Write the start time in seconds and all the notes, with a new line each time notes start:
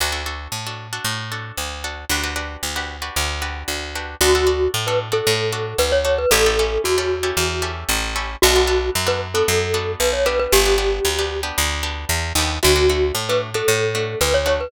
0.00 D2 D4 F#4 A4
0.12 D4 F#4 A4
0.26 D4 F#4 A4
0.52 A2
0.67 D4 F#4 A4
0.93 D4 F#4 A4
1.04 A2
1.32 D4 F#4 A4
1.57 D2
1.84 D4 F#4 A4
2.09 D2 D4 F#4 G4 B4
2.23 D4 F#4 G4 B4
2.36 D4 F#4 G4 B4
2.63 D2
2.76 D4 F#4 G4 B4
3.02 D4 F#4 G4 B4
3.16 D2
3.42 D4 F#4 G4 B4
3.68 D2
3.95 D4 F#4 G4 B4
4.21 D2 D4 F#4 A4
4.35 D4 F#4 A4
4.47 D4 F#4 A4
4.74 A2
4.87 D4 F#4 A4 B4
5.12 D4 F#4 A4
5.27 A2
5.53 D4 F#4 A4
5.78 D2 B4
5.92 C#5
6.05 D4 F#4 A4 C#5
6.18 B4
6.31 A1 C#4 E4 G4 A4
6.46 C#4 E4 G4 A4
6.59 C#4 E4 G4 A4
6.84 E2 F#4
6.98 C#4 E4 G4 A4
7.23 C#4 E4 G4 A4
7.37 E2
7.62 C#4 E4 G4 A4
7.89 A1
8.16 C#4 E4 G4 A4
8.42 B1 B3 D4 F#4 A4
8.56 B3 D4 F#4 A4
8.67 B3 D4 F#4 A4
8.95 F#2
9.07 B3 D4 F#4 A4 B4
9.34 B3 D4 F#4 A4
9.48 F#2
9.74 B3 D4 F#4 A4
10.00 B1 B4
10.13 C#5
10.26 B3 D4 G4 B4
10.39 B4
10.52 G1 G4
10.66 B3 D4 G4
10.78 B3 D4 G4
11.05 D2
11.19 B3 D4 G4
11.43 B3 D4 G4
11.58 D2
11.83 B3 D4 G4
12.09 E2
12.35 D#2 B3 D4 G4
12.63 D2 A3 D4 F#4
12.76 A3 D4 F#4
12.89 A3 D4 F#4
13.15 A2
13.29 A3 D4 F#4 B4
13.54 A3 D4 F#4 A4
13.68 A2
13.95 A3 D4 F#4
14.21 D2 B4
14.34 C#5
14.46 A3 D4 F#4 C#5
14.61 B4